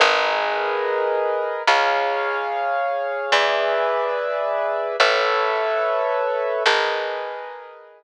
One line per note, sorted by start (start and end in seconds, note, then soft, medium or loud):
0.00 1.54 G#1 medium
0.00 1.63 G#4 medium
0.00 1.63 A#4 medium
0.00 1.63 B4 medium
0.00 1.63 D#5 medium
1.67 3.21 C#2 medium
1.67 3.31 G#4 medium
1.67 3.31 C#5 medium
1.67 3.31 F5 medium
3.32 4.86 E2 medium
3.32 4.96 G#4 medium
3.32 4.96 B4 medium
3.32 4.96 D5 medium
3.32 4.96 E5 medium
5.00 6.53 A1 medium
5.00 6.63 A4 medium
5.00 6.63 B4 medium
5.00 6.63 C#5 medium
5.00 6.63 E5 medium
6.66 8.03 G#1 medium
6.66 8.03 G#4 medium
6.66 8.03 A#4 medium
6.66 8.03 B4 medium
6.66 8.03 D#5 medium